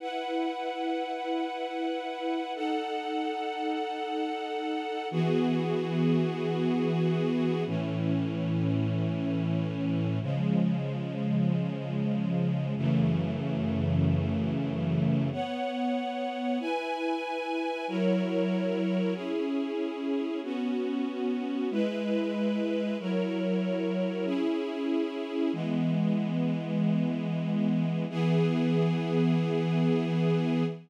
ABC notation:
X:1
M:4/4
L:1/8
Q:1/4=94
K:E
V:1 name="String Ensemble 1"
[EBf]8 | [DAf]8 | [E,B,FG]8 | [A,,E,C]8 |
[C,^E,G,]8 | [F,,C,E,A,]8 | [K:B] [B,cf]4 [EBg]4 | [F,EAc]4 [CEG]4 |
[B,CF]4 [G,EB]4 | [F,EAc]4 [CEG]4 | [K:E] [E,G,B,]8 | [E,B,G]8 |]